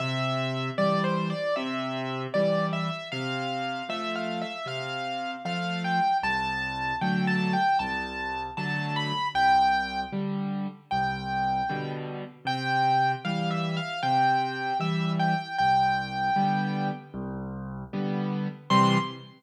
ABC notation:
X:1
M:4/4
L:1/8
Q:1/4=77
K:C
V:1 name="Acoustic Grand Piano"
e2 (3d c d e2 d e | f2 (3e f e f2 f g | a2 (3g a g a2 a b | g2 z2 g3 z |
g2 (3f e f g2 e g | g4 z4 | c'2 z6 |]
V:2 name="Acoustic Grand Piano"
C,2 [E,G,]2 C,2 [E,G,]2 | C,2 [F,A,]2 C,2 [F,A,]2 | C,,2 [D,^F,A,]2 C,,2 [D,F,A,]2 | C,,2 [D,G,]2 C,,2 [B,,D,G,]2 |
C,2 [E,G,]2 C,2 [E,G,]2 | C,,2 [D,G,B,]2 C,,2 [D,G,B,]2 | [C,E,G,]2 z6 |]